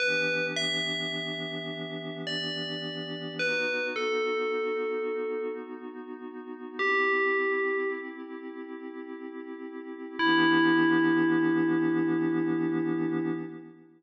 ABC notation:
X:1
M:3/4
L:1/8
Q:1/4=53
K:Em
V:1 name="Tubular Bells"
B e3 d2 | B A3 z2 | G2 z4 | E6 |]
V:2 name="Pad 5 (bowed)"
[E,B,DG]6 | [B,^DF]6 | [CEG]6 | [E,B,DG]6 |]